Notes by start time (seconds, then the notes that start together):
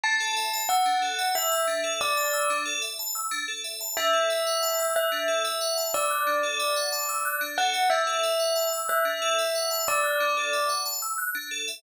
0.03 D4 A5
0.20 A4
0.36 E5
0.53 A5
0.69 F#5 E6
0.86 D4
1.02 A4
1.19 E5
1.35 E5 A5
1.52 E6
1.67 D4
1.84 A4
2.01 D5 E5
2.17 A5
2.33 E6
2.50 D4
2.66 A4
2.82 E5
2.99 A5
3.15 E6
3.31 D4
3.48 A4
3.64 E5
3.81 A5
3.97 D4 E5
4.13 A4
4.30 E5
4.47 F#5
4.63 A5
4.80 E6
4.95 E5 F#6
5.12 D4
5.28 A4
5.45 E5
5.61 F#5
5.77 A5
5.94 D5 E6
6.10 F#6
6.27 D4
6.43 A4
6.60 E5
6.76 F#5
6.92 A5
7.09 E6
7.25 F#6
7.41 D4
7.58 A4 F#5
7.74 E5
7.90 D4 E5
8.07 A4
8.23 E5
8.40 F#5
8.56 A5
8.73 E6
8.88 E5 F#6
9.05 D4
9.22 A4
9.39 E5
9.55 F#5
9.71 A5
9.87 D5 E6
10.04 F#6
10.20 D4
10.37 A4
10.53 E5
10.69 F#5
10.86 A5
11.02 E6
11.18 F#6
11.35 D4
11.51 A4
11.68 E5